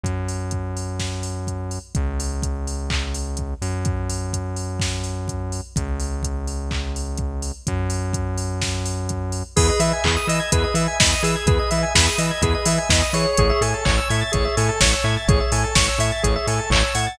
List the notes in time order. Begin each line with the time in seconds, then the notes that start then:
0.04 F#2, kick, closed hi-hat
0.28 open hi-hat
0.51 kick, closed hi-hat
0.77 open hi-hat
1.00 kick, snare
1.23 open hi-hat
1.47 kick, closed hi-hat
1.71 open hi-hat
1.95 C#2, kick, closed hi-hat
2.20 open hi-hat
2.42 kick, closed hi-hat
2.67 open hi-hat
2.90 kick, clap
3.14 open hi-hat
3.37 kick, closed hi-hat
3.62 F#2, open hi-hat
3.85 kick, closed hi-hat
4.10 open hi-hat
4.33 kick, closed hi-hat
4.56 open hi-hat
4.80 kick, snare
5.04 open hi-hat
5.28 kick, closed hi-hat
5.52 open hi-hat
5.76 C#2, kick, closed hi-hat
6.00 open hi-hat
6.23 kick, closed hi-hat
6.48 open hi-hat
6.71 kick, clap
6.96 open hi-hat
7.17 kick, closed hi-hat
7.42 open hi-hat
7.67 F#2, kick, closed hi-hat
7.90 open hi-hat
8.13 kick, closed hi-hat
8.38 open hi-hat
8.62 kick, snare
8.86 open hi-hat
9.09 kick, closed hi-hat
9.32 open hi-hat
9.56 E2 G#4 B4, kick, crash
9.69 D#5
9.80 E3 E5, open hi-hat
9.93 G#5
10.04 E2 G#4 B5, kick, clap
10.17 D#6
10.27 E3 D#5 E6, open hi-hat
10.40 G#6
10.52 E2 G#4 B4, kick, closed hi-hat
10.64 D#5
10.74 E3 E5, open hi-hat
10.88 G#5
10.99 E2 D#5 B5, kick, snare
11.12 D#6
11.23 E3 G#4 E6, open hi-hat
11.36 G#6
11.46 E2 G#4 B4, kick, closed hi-hat
11.59 D#5
11.71 E3 E5, open hi-hat
11.83 G#5
11.94 E2 G#4 B5, kick, snare
12.07 D#6
12.18 E3 D#5 E6, open hi-hat
12.31 G#6
12.42 E2 G#4 B4, kick, closed hi-hat
12.55 D#5
12.65 E3 E5, open hi-hat
12.78 G#5
12.89 E2 D#5 B5, kick, snare
13.02 D#6
13.13 E3 G#4 C#5, open hi-hat
13.37 A1 G#4, kick, closed hi-hat
13.50 E5
13.61 A2 A4 G#5, open hi-hat
13.74 A5
13.85 A1 C#5 C#6, kick, clap
13.98 E6
14.09 A2 E5 G#6, open hi-hat
14.21 A6
14.32 A1 G#4 C#5, kick, closed hi-hat
14.45 E5
14.57 A2 A4 G#5, open hi-hat
14.69 A5
14.81 A1 C#5 C#6, kick, snare
14.93 E6
15.04 A2 E5 G#6
15.17 A6
15.28 A1 G#4 C#5, kick, closed hi-hat
15.40 E5
15.52 A2 A4 G#5, open hi-hat
15.64 A5
15.75 A1 C#5 C#6, kick, snare
15.88 E6
15.98 A2 E5 G#6, open hi-hat
16.12 A6
16.23 A1 G#4 C#5, kick, closed hi-hat
16.36 E5
16.47 A2 A4 G#5, open hi-hat
16.59 A5
16.70 A1 C#5 C#6, kick, clap
16.83 E6
16.95 A2 F#5 G#6, open hi-hat
17.07 A6